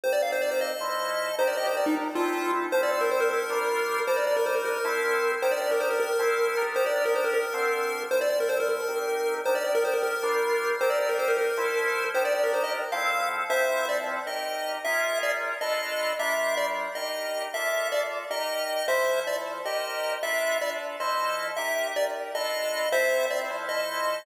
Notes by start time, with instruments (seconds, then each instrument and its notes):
0.04 drawbar organ C4 D#4 G4 A#4, lead 1 (square) C5
0.13 lead 1 (square) D5
0.22 lead 1 (square) F5
0.32 lead 1 (square) C5
0.42 lead 1 (square) D5
0.51 lead 1 (square) C5
0.61 lead 1 (square) D#5
0.80 drawbar organ F3 E4 A4 C5
1.38 drawbar organ D#3 D4 G4 A#4, lead 1 (square) C5
1.48 lead 1 (square) D5
1.57 lead 1 (square) D#5
1.67 lead 1 (square) C5
1.77 lead 1 (square) D5
1.86 lead 1 (square) D#4
2.15 drawbar organ F3 C4 E4 A4, lead 1 (square) F4
2.72 drawbar organ F3 C4 E4 A4, lead 1 (square) C5
2.83 lead 1 (square) D5
2.92 lead 1 (square) D5
3.01 lead 1 (square) A#4
3.11 lead 1 (square) C5
3.20 lead 1 (square) A#4
3.31 lead 1 (square) A#4
3.50 drawbar organ G3 D4 F4 A#4
4.07 drawbar organ G3 D4 D#4 A#4, lead 1 (square) C5
4.17 lead 1 (square) D5
4.27 lead 1 (square) D5
4.37 lead 1 (square) A#4
4.46 lead 1 (square) C5
4.56 lead 1 (square) A#4
4.65 lead 1 (square) A#4
4.84 drawbar organ F3 C4 E4 A4
5.42 drawbar organ D#3 D4 G4 A#4, lead 1 (square) C5
5.52 lead 1 (square) D5
5.62 lead 1 (square) D5
5.71 lead 1 (square) A#4
5.80 lead 1 (square) C5
5.90 lead 1 (square) A#4
6.00 lead 1 (square) A#4
6.19 drawbar organ F3 C4 E4 A4
6.57 drawbar organ D#3 D4 G4 A#4
6.76 lead 1 (square) C5
6.86 lead 1 (square) D5
6.96 lead 1 (square) D5
7.05 lead 1 (square) A#4
7.15 lead 1 (square) C5
7.24 lead 1 (square) A#4
7.34 lead 1 (square) A#4
7.54 drawbar organ D3 C4 F4 A4
8.11 drawbar organ F3 C4 E4 A4, lead 1 (square) C5
8.21 lead 1 (square) D5
8.30 lead 1 (square) D5
8.40 lead 1 (square) A#4
8.49 lead 1 (square) C5
8.60 lead 1 (square) A#4
8.69 lead 1 (square) A#4
8.88 drawbar organ C4 D#4 G4 A#4
9.45 drawbar organ D#3 D4 G4 A#4, lead 1 (square) C5
9.55 lead 1 (square) D5
9.64 lead 1 (square) D5
9.75 lead 1 (square) A#4
9.85 lead 1 (square) C5
9.94 lead 1 (square) A#4
10.03 lead 1 (square) A#4
10.23 drawbar organ G3 D4 F4 A#4
10.81 drawbar organ C4 D#4 G4 A#4, lead 1 (square) C5
10.90 lead 1 (square) D5
11.00 lead 1 (square) D5
11.09 lead 1 (square) A#4
11.19 lead 1 (square) C5
11.28 lead 1 (square) A#4
11.38 lead 1 (square) A#4
11.57 drawbar organ F3 E4 A4 C5
12.15 drawbar organ D#3 D4 G4 A#4, lead 1 (square) C5
12.25 lead 1 (square) D5
12.35 lead 1 (square) D5
12.44 lead 1 (square) A#4
12.54 lead 1 (square) C5
12.64 lead 1 (square) D#5
12.92 drawbar organ F3 C4 E4 A4, lead 1 (square) F5
13.50 drawbar organ F3 C4 E4 A4, lead 1 (square) C5 E5
13.89 lead 1 (square) D5
14.26 drawbar organ D#4 G4 A#4, lead 1 (square) D#5
14.85 drawbar organ C#4 F4 G#4 A#4, lead 1 (square) E5
15.23 lead 1 (square) D5
15.61 drawbar organ D4 F4 A4 B4, lead 1 (square) D#5
16.19 drawbar organ G3 D4 F4 A#4, lead 1 (square) E5
16.57 lead 1 (square) D5
16.95 drawbar organ D#4 G4 A#4, lead 1 (square) D#5
17.54 drawbar organ A#3 F4 A4 D5, lead 1 (square) E5
17.92 lead 1 (square) D5
18.30 drawbar organ D#4 G4 A#4, lead 1 (square) D#5
18.88 drawbar organ F3 E4 A4 C5, lead 1 (square) C5 E5
19.26 drawbar organ F3 E4 A4 C5, lead 1 (square) D5
19.65 drawbar organ D#4 G4 A#4 C5, lead 1 (square) D#5
20.23 drawbar organ D4 F4 A4 B4, lead 1 (square) E5
20.61 drawbar organ D4 F4 A4 B4, lead 1 (square) D5
21.00 drawbar organ F3 E4 A4 C5, lead 1 (square) D#5
21.57 drawbar organ D#4 G4 A#4, lead 1 (square) E5
21.96 drawbar organ D#4 G4 A#4, lead 1 (square) D5
22.34 drawbar organ D4 F4 A4 B4, lead 1 (square) D#5
22.92 drawbar organ C4 E4 F4 A4, lead 1 (square) C5 E5
23.30 drawbar organ C4 E4 F4 A4, lead 1 (square) D5
23.50 drawbar organ F3 E4 A4 C5
23.69 lead 1 (square) D#5